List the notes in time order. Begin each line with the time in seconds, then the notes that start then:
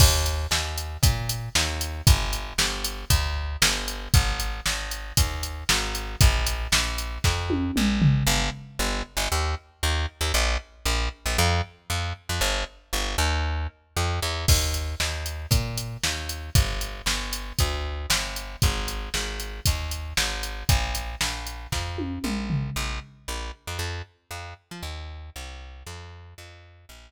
0.00 D#2, kick, crash
0.26 closed hi-hat
0.51 D#2, snare
0.78 closed hi-hat
1.03 A#2, kick, closed hi-hat
1.29 closed hi-hat
1.55 D#2, snare
1.81 closed hi-hat
2.07 G1, kick, closed hi-hat
2.33 closed hi-hat
2.58 G1, snare
2.84 closed hi-hat
3.10 D2, kick, closed hi-hat
3.62 G1, snare, closed hi-hat
3.88 closed hi-hat
4.14 G#1, kick, closed hi-hat
4.40 closed hi-hat
4.66 G#1, snare
4.91 closed hi-hat
5.17 D#2, kick, closed hi-hat
5.43 closed hi-hat
5.69 G#1, snare
5.95 closed hi-hat
6.21 A#1, kick, closed hi-hat
6.47 closed hi-hat
6.72 A#1, snare
6.98 closed hi-hat
7.24 F2, kick, snare
7.50 high tom
7.76 A#1, mid tom
8.02 floor tom
8.27 G1
8.79 G1
9.17 G1
9.32 D#2
9.83 D#2
10.21 D#2
10.34 A#1
10.85 A#1
11.26 A#1
11.38 F2
11.90 F2
12.29 F2
12.41 G1
12.93 G1
13.18 D#2
13.97 F2
14.22 E2
14.48 D#2, kick, crash
14.74 closed hi-hat
15.00 D#2, snare
15.26 closed hi-hat
15.51 A#2, kick, closed hi-hat
15.77 closed hi-hat
16.03 D#2, snare
16.29 closed hi-hat
16.55 G1, kick, closed hi-hat
16.81 closed hi-hat
17.06 G1, snare
17.33 closed hi-hat
17.59 D2, kick, closed hi-hat
18.10 G1, snare, closed hi-hat
18.36 closed hi-hat
18.62 G#1, kick, closed hi-hat
18.88 closed hi-hat
19.14 G#1, snare
19.40 closed hi-hat
19.66 D#2, kick, closed hi-hat
19.91 closed hi-hat
20.17 G#1, snare
20.43 closed hi-hat
20.69 A#1, kick, closed hi-hat
20.95 closed hi-hat
21.21 A#1, snare
21.47 closed hi-hat
21.72 F2, kick, snare
21.98 high tom
22.24 A#1, mid tom
22.50 floor tom
22.76 A#1
23.28 A#1
23.67 F2
23.79 F2
24.31 F2
24.71 F3
24.83 D#2
25.36 C2
25.87 F2
26.38 F2
26.89 A#1